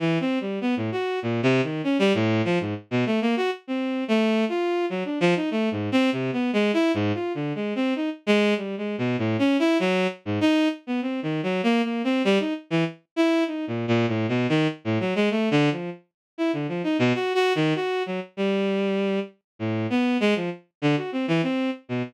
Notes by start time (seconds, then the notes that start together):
0.00 E3
0.20 C4
0.41 G3
0.61 B3
0.77 A2
0.92 F#4
1.22 A#2
1.43 C3
1.63 D#3
1.84 C#4
1.99 G3
2.14 A2
2.45 F3
2.60 G#2
2.91 B2
3.06 A3
3.21 A#3
3.37 F#4
3.67 C4
4.08 A3
4.49 F4
4.90 F#3
5.05 D4
5.20 F3
5.36 D#4
5.51 A3
5.71 G#2
5.92 C4
6.12 C3
6.33 B3
6.53 G#3
6.73 E4
6.94 G#2
7.14 F4
7.35 D3
7.55 G#3
7.75 C4
7.96 D#4
8.27 G#3
8.57 G3
8.78 G#3
8.98 B2
9.18 A2
9.39 C#4
9.59 E4
9.80 F#3
10.25 G#2
10.41 D#4
10.87 B3
11.02 C4
11.23 D#3
11.43 F#3
11.63 A#3
11.84 A#3
12.04 C4
12.25 G3
12.40 D#4
12.70 E3
13.16 E4
13.47 D#4
13.67 A#2
13.88 A#2
14.08 A2
14.29 B2
14.49 D#3
14.85 A2
15.00 F#3
15.15 G#3
15.31 A3
15.51 D3
15.71 F3
16.38 E4
16.53 D3
16.68 F3
16.84 D#4
16.99 B2
17.14 F#4
17.35 F#4
17.55 D#3
17.75 F#4
18.06 F#3
18.37 G3
19.59 A2
19.90 B3
20.20 G#3
20.36 F3
20.82 D3
20.97 F#4
21.12 C4
21.28 E3
21.43 C4
21.89 B2